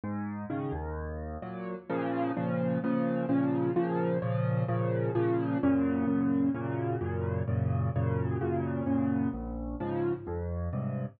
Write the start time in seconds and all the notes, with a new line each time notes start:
0.04 G#2
0.50 C#3 D#3
0.72 D#2
1.42 A#2 F#3
1.90 A#2 C#3 F3
2.37 A#2 C#3 F3
2.84 A#2 C#3 F3
3.29 A#2 C#3 F3
3.76 A#2 C#3 F3
4.22 A#2 C#3 F3
4.68 A#2 C#3 F3
5.15 A#2 C#3 F3
5.63 F#2 A#2 C#3
6.07 F#2 A#2 C#3
6.54 F#2 A#2 C#3
7.01 F#2 A#2 C#3
7.48 F#2 A#2 C#3
7.96 F#2 A#2 C#3
8.41 F#2 A#2 C#3
8.86 F#2 A#2 C#3
9.33 A#1
9.80 G#2 C#3 F3
10.27 F2
10.73 G2 G#2 C3